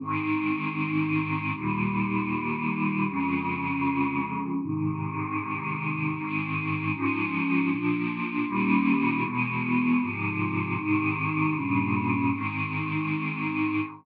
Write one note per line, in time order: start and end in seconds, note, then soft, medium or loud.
0.00 1.52 G#2 medium
0.00 1.52 D#3 medium
0.00 1.52 C4 loud
1.54 3.06 D#2 loud
1.54 3.06 A#2 medium
1.54 3.06 G3 medium
3.08 4.60 F2 loud
3.08 4.60 C#3 medium
3.08 4.60 G#3 medium
4.61 6.13 G#2 medium
4.61 6.13 C3 medium
4.61 6.13 D#3 medium
6.16 6.92 G#2 loud
6.16 6.92 D#3 medium
6.16 6.92 C4 medium
6.93 7.69 G#2 loud
6.93 7.69 F3 loud
6.93 7.69 C#4 medium
7.69 8.46 A#2 medium
7.69 8.46 F3 medium
7.69 8.46 D4 medium
8.46 9.23 D#2 medium
8.46 9.23 A#2 loud
8.46 9.23 G3 loud
8.46 9.23 C#4 medium
9.23 10.00 E2 medium
9.23 10.00 B2 loud
9.23 10.00 G#3 loud
10.00 10.76 G#2 loud
10.00 10.76 C3 medium
10.00 10.76 F3 medium
10.76 11.53 G#2 loud
10.76 11.53 C3 medium
10.76 11.53 D#3 loud
11.54 12.30 G2 medium
11.54 12.30 A#2 medium
11.54 12.30 C#3 loud
12.31 13.80 G#2 medium
12.31 13.80 D#3 medium
12.31 13.80 C4 loud